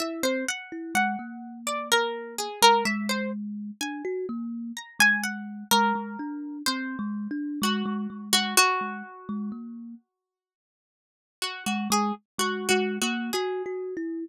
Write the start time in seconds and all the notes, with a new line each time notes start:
0.00 E4 E5
0.23 C4 C5
0.48 F#5
0.72 E4
0.95 G#3 F#5
1.19 A#3
1.67 D5
1.92 A#4
2.38 G#4
2.62 G#3 A#4
2.85 G#3 E5
3.09 C5
3.81 D4 G#5
4.05 F#4
4.29 A#3
4.77 A#5
4.99 G#3 G#5
5.24 F#5
5.71 G#3 A#4
5.95 G#3
6.19 D4
6.66 C4 C5
6.99 G#3
7.31 D4
7.62 G#3 F#4
7.86 G#3
8.10 G#3
8.33 G#3 F#4
8.57 F#4
8.81 G#3
9.29 G#3
9.52 A#3
11.42 F#4
11.66 G#3 F#4
11.90 G#3 G#4
12.38 G#3 F#4
12.69 G#3 F#4
13.02 A#3 F#4
13.33 F#4 G#4
13.66 F#4
13.97 E4